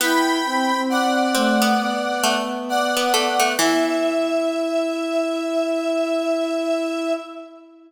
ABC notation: X:1
M:4/4
L:1/16
Q:"Swing 16ths" 1/4=67
K:Em
V:1 name="Lead 1 (square)"
[gb]4 [df]8 [df]4 | e16 |]
V:2 name="Ocarina"
E2 C C3 A,2 B,6 B, B, | E16 |]
V:3 name="Harpsichord"
B,4 z2 C B,3 A,3 B, A, A, | E,16 |]